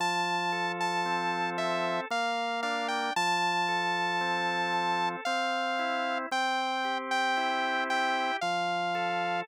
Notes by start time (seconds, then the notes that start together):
0.00 F3 A5
0.52 A4
0.80 A5
1.05 C4
1.58 A4 E5
2.11 A#3 F5
2.63 D4 F5
2.88 G5
3.16 F3 A5
3.68 A4
4.21 C4
4.74 A4
5.25 C4 F5
5.79 E4
6.31 C4 G5
6.84 G4
7.11 G5
7.37 E4
7.90 G4 G5
8.41 F3 F5
8.95 A4